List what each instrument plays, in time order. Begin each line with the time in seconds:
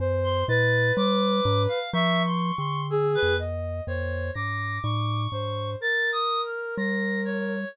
0.00 glockenspiel F#2, ocarina C5
0.24 clarinet C6
0.48 glockenspiel A#2, ocarina B4, clarinet A6
0.97 glockenspiel G3, clarinet D6
1.45 glockenspiel G#2
1.68 clarinet F5
1.93 glockenspiel F3, clarinet E5, ocarina C#6
2.26 clarinet C6
2.58 glockenspiel D3, clarinet C6
2.90 ocarina G#4, clarinet E6
3.15 clarinet B4
3.23 glockenspiel F2
3.39 ocarina D#5
3.87 glockenspiel F2, ocarina C5, clarinet C#5
4.34 glockenspiel G#2, ocarina D6, clarinet A#6
4.83 glockenspiel A2, clarinet C#6
5.32 glockenspiel G#2, ocarina C5
5.80 ocarina A#4, clarinet A6
6.13 clarinet D#6
6.45 clarinet F6
6.77 glockenspiel G3, clarinet A#6
7.25 clarinet C#5